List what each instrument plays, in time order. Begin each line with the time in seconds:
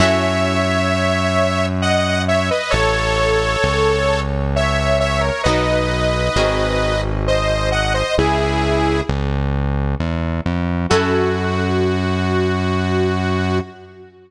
0.00 synth bass 1 F#2, orchestral harp C#4 E4 F#4 A4, lead 2 (sawtooth) C#5 E5
1.82 lead 2 (sawtooth) D#5 F#5
2.28 lead 2 (sawtooth) C#5 E5
2.51 lead 2 (sawtooth) B4 D#5
2.70 synth bass 1 A1, lead 2 (sawtooth) A4 C#5
3.64 synth bass 1 C#2
4.56 lead 2 (sawtooth) C#5 E5
5.00 lead 2 (sawtooth) C#5 E5
5.20 lead 2 (sawtooth) A#4 C#5
5.43 synth bass 1 B1, orchestral harp B3 D#4 F#4 A#4, lead 2 (sawtooth) B4 D#5
6.36 synth bass 1 G#1, orchestral harp C4 F#4 G#4 A#4
7.27 lead 2 (sawtooth) C5 D#5
7.72 lead 2 (sawtooth) D#5 F#5
7.94 lead 2 (sawtooth) C5 D#5
8.18 synth bass 1 C#2, lead 2 (sawtooth) E4 G#4
9.09 synth bass 1 C#2
10.00 synth bass 1 E2
10.46 synth bass 1 F2
10.90 synth bass 1 F#2, orchestral harp C#4 E4 F#4 A4, lead 2 (sawtooth) F#4